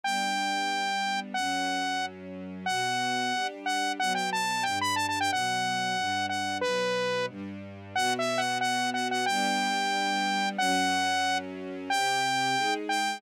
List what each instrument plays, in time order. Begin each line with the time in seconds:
0.04 string ensemble 1 G3 B3 D4, lead 2 (sawtooth) G5
1.34 string ensemble 1 F#2 F#3 C#4, lead 2 (sawtooth) F#5
2.66 string ensemble 1 B2 B3 F#4, lead 2 (sawtooth) F#5
3.33 string ensemble 1 G3 D4 G4
3.66 lead 2 (sawtooth) F#5
3.99 string ensemble 1 B2 F#3 B3, lead 2 (sawtooth) F#5
4.15 lead 2 (sawtooth) G5
4.33 lead 2 (sawtooth) A5
4.63 string ensemble 1 G2 G3 D4, lead 2 (sawtooth) G5
4.81 lead 2 (sawtooth) B5
4.96 lead 2 (sawtooth) A5
5.09 lead 2 (sawtooth) A5
5.21 lead 2 (sawtooth) G5
5.31 string ensemble 1 B2 F#3 B3, lead 2 (sawtooth) F#5
5.97 string ensemble 1 G2 G3 D4
6.29 lead 2 (sawtooth) F#5
6.61 string ensemble 1 B2 F#3 B3, lead 2 (sawtooth) B4
7.29 string ensemble 1 G2 G3 D4
7.95 string ensemble 1 B2 B3 F#4, lead 2 (sawtooth) F#5
8.19 lead 2 (sawtooth) E5
8.38 lead 2 (sawtooth) F#5
8.61 lead 2 (sawtooth) F#5
8.94 lead 2 (sawtooth) F#5
9.11 lead 2 (sawtooth) F#5
9.26 string ensemble 1 G3 B3 D4, lead 2 (sawtooth) G5
10.58 string ensemble 1 F#2 F#3 C#4, lead 2 (sawtooth) F#5
11.90 string ensemble 1 C3 C4 G4, lead 2 (sawtooth) G5
12.56 string ensemble 1 G#3 D#4 G#4
12.89 lead 2 (sawtooth) G5